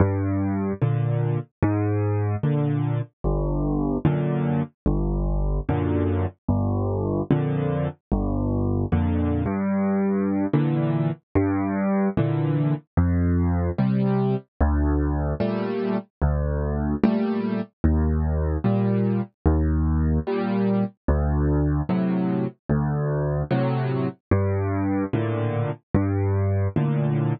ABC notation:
X:1
M:6/8
L:1/8
Q:3/8=74
K:Gm
V:1 name="Acoustic Grand Piano"
G,,3 [B,,D,]3 | _A,,3 [B,,D,]3 | G,,,3 [^F,,B,,D,]3 | G,,,3 [^F,,B,,D,]3 |
G,,,3 [F,,B,,D,]3 | G,,,3 [F,,B,,D,]2 G,,- | G,,3 [B,,D,=E,]3 | G,,3 [B,,D,=E,]3 |
F,,3 [C,G,]3 | D,,3 [B,,G,A,]3 | D,,3 [B,,G,A,]3 | E,,3 [B,,G,]3 |
E,,3 [B,,G,]3 | D,,3 [A,,C,^F,]3 | D,,3 [A,,C,^F,]3 | G,,3 [A,,B,,D,]3 |
G,,3 [A,,B,,D,]3 |]